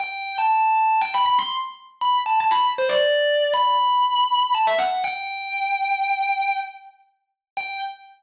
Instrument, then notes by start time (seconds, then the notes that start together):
distortion guitar
0.00 G5
0.38 A5
0.75 A5
1.01 G5
1.14 B5
1.25 B5
1.38 C6
2.01 B5
2.26 A5
2.40 A5
2.51 B5
2.78 C5
2.89 D5
3.54 B5
4.55 A5
4.67 E5
4.78 F#5
5.04 G5
7.57 G5